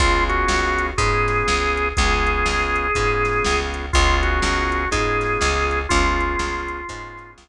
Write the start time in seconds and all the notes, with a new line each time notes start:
0.00 C#2 B3 C#4 F4 G#4, kick, closed hi-hat
0.29 F#4, closed hi-hat
0.48 C#2, snare
0.78 closed hi-hat
0.98 G#2 B3 C#4 F4 G#4, kick, closed hi-hat
1.28 snare, closed hi-hat
1.48 C#2, snare
1.77 closed hi-hat
1.97 C#2 B3 C#4 F4 G#4, kick, closed hi-hat
2.27 closed hi-hat
2.46 C#2, snare
2.76 closed hi-hat
2.95 G#2 B3 C#4 F4 G#4, kick, closed hi-hat
3.25 snare, closed hi-hat
3.44 C#2, snare
3.74 closed hi-hat
3.93 C#2 B3 C#4 F4 G#4, kick, closed hi-hat
4.23 F#4, closed hi-hat
4.42 C#2, snare
4.72 closed hi-hat
4.91 G#2 B3 C#4 F4 G#4, kick, closed hi-hat
5.21 snare, closed hi-hat
5.41 C#2, snare
5.71 closed hi-hat
5.89 C#2 B3 C#4 F4 G#4, kick, closed hi-hat
6.20 closed hi-hat
6.39 C#2, snare
6.68 closed hi-hat
6.89 G#2 B3 C#4 F4 G#4, kick, closed hi-hat
7.18 snare, closed hi-hat
7.38 C#2, snare